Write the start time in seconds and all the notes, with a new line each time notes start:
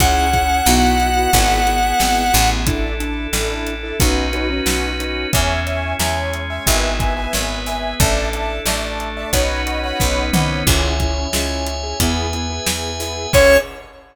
0.00 C#2 C#4 E4 G#4 F#5, kick, closed hi-hat
0.33 C#4 E4 G#4, kick, closed hi-hat
0.66 B1 B3 E4 F#4, snare
1.00 closed hi-hat
1.17 B3 E4 F#4
1.33 G#1 B3 E4 G#4, kick, closed hi-hat
1.67 B3 E4 G#4, closed hi-hat
1.83 B3 E4 G#4
2.00 G#1, snare
2.33 A1 B3 E4 G#4, open hi-hat
2.67 D4 E4 A4, kick, closed hi-hat
3.00 D4 E4 A4, closed hi-hat
3.33 A1 D4 E4 A4, snare
3.67 closed hi-hat
3.83 D4 E4 A4
4.00 B1 C#4 D#4 F#4 B4, kick, closed hi-hat
4.33 C#4 D#4 F#4 B4, closed hi-hat
4.50 C#4 D#4 F#4 B4
4.66 B1, snare
5.00 C#4 D#4 F#4 B4, closed hi-hat
5.33 E2 C#4 E4 G#4 C#5 E5 G#5, kick, closed hi-hat
5.67 C#5 E5 G#5, closed hi-hat
5.99 E2 G#3 C#4 G#4 C#5 E5 G#5, snare
6.33 closed hi-hat
6.50 C#5 E5 G#5
6.66 G#1 B3 E4 G#4 B4 E5 G#5, kick, closed hi-hat
7.00 B4 E5 G#5, kick, closed hi-hat
7.17 B4 E5 G#5
7.33 G#1 B3 G#4 B4, snare
7.66 B4 E5 G#5, open hi-hat
8.00 A1 D4 E4 A4 D5 E5 A5, kick, closed hi-hat
8.33 D5 E5 A5, closed hi-hat
8.66 A1 A3 D4 A4 D5 E5 A5, snare
9.00 closed hi-hat
9.17 D5 E5 A5
9.33 B1 C#4 D#4 F#4 B4 C#5 D#5 F#5 B5, kick, closed hi-hat
9.67 C#5 D#5 F#5 B5, closed hi-hat
9.83 C#5 D#5 F#5 B5
10.00 B1 B3 C#4 D#4 B4, kick, snare
10.33 C2 C#5 D#5 F#5 B5, mid tom
10.67 C#2 C#4 E4 G#4 C#5 E5 G#5, kick, crash
11.00 C#4 E4 G#4, kick, closed hi-hat
11.33 C#2 C#4 E4 G#4, snare
11.66 closed hi-hat
11.83 C#4 E4 G#4
12.00 E2 B3 E4 G#4 B4 E5 G#5, kick, closed hi-hat
12.33 B3 E4 G#4, closed hi-hat
12.50 B3 E4 G#4
12.67 E2, snare
13.00 B3 E4 G#4, open hi-hat
13.33 C#2 C#4 E4 G#4 C#5, kick, crash